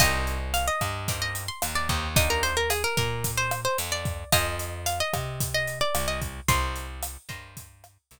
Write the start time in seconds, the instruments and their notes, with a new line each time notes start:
0.00 electric bass (finger) C2, acoustic guitar (steel) A#3 C4 D#4 G4 D#5, kick, cross-stick, closed hi-hat
0.27 closed hi-hat
0.54 acoustic guitar (steel) F5, closed hi-hat
0.68 acoustic guitar (steel) D#5
0.81 electric bass (finger) G2, kick, cross-stick, closed hi-hat
1.08 acoustic guitar (steel) A#3 C4 D#4 G4, kick, closed hi-hat
1.22 acoustic guitar (steel) D#5
1.35 closed hi-hat
1.48 acoustic guitar (steel) C6
1.62 electric bass (finger) D#2, cross-stick, closed hi-hat
1.75 acoustic guitar (steel) D5
1.89 electric bass (finger) D#2, acoustic guitar (steel) A#3 C4 D#4 G4, kick, closed hi-hat
2.16 acoustic guitar (steel) A#3 D4 D#4 G4 D#5, kick, closed hi-hat
2.30 acoustic guitar (steel) A#4
2.43 acoustic guitar (steel) C5, closed hi-hat
2.57 acoustic guitar (steel) A#4
2.70 acoustic guitar (steel) G#4, cross-stick, closed hi-hat
2.84 acoustic guitar (steel) A#4
2.97 electric bass (finger) A#2, acoustic guitar (steel) A#4, kick, closed hi-hat
3.24 kick, closed hi-hat
3.38 acoustic guitar (steel) C5
3.51 cross-stick, closed hi-hat
3.65 acoustic guitar (steel) C5
3.78 electric bass (finger) F2, closed hi-hat
3.92 acoustic guitar (steel) D5
4.05 kick, closed hi-hat
4.32 electric bass (finger) F2, acoustic guitar (steel) C5 D#5 F5 G#5, kick, cross-stick, closed hi-hat
4.59 closed hi-hat
4.86 acoustic guitar (steel) F5, closed hi-hat
5.00 acoustic guitar (steel) D#5
5.13 electric bass (finger) C3, kick, cross-stick, closed hi-hat
5.40 kick, closed hi-hat
5.54 acoustic guitar (steel) D#5
5.67 closed hi-hat
5.81 acoustic guitar (steel) D5
5.95 electric bass (finger) C2, cross-stick, closed hi-hat
6.08 acoustic guitar (steel) D#5
6.22 kick, closed hi-hat
6.48 electric bass (finger) C2, acoustic guitar (steel) A#4 C5 D#5 G5 C6, kick, closed hi-hat
6.76 closed hi-hat
7.03 cross-stick, closed hi-hat
7.29 electric bass (finger) G2, acoustic guitar (steel) A#4 C5 D#5 G5, kick, closed hi-hat
7.57 kick, closed hi-hat
7.84 cross-stick, closed hi-hat
8.11 electric bass (finger) C2, closed hi-hat